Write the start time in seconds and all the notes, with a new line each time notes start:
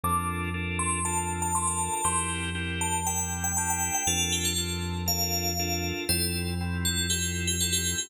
0.03 F2 D4 F4 A4 A#4 D6
0.54 D4 F4 A4 A#4
0.79 C6
1.05 D4 F4 A4 A#4 A5
1.42 A5
1.55 D4 F4 A4 A#4 C6
1.67 A5
1.93 A5
2.04 F2 C4 E4 G4 A#4 C6
2.55 C4 E4 G4 A#4
2.81 A5
3.06 C4 E4 G4 A#4 G5
3.44 G5
3.57 C4 E4 G4 A#4 A5
3.70 G5
3.95 G5
4.07 F2 D4 F4 A4 A#4
4.32 G4
4.45 A4
4.58 D4 F4 A4 A#4
5.06 D4 F4 A4 A#4 F5
5.59 D4 F4 A4 A#4
6.09 F2 C4 E4 F4 A4 C5
6.61 C4 E4 F4 A4
6.85 A4
7.10 C4 E4 F4 G4 A4
7.47 G4
7.61 C4 E4 F4 A4
7.73 G4
7.98 G4